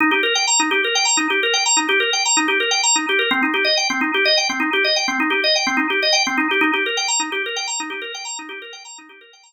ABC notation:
X:1
M:7/8
L:1/16
Q:1/4=127
K:Eb
V:1 name="Drawbar Organ"
E G B g b E G B g b E G B g | b E G B g b E G B g b E G B | C E G e g C E G e g C E G e | g C E G e g C E G e g C E G |
E G B g b E G B g b E G B g | b E G B g b E G B g b z3 |]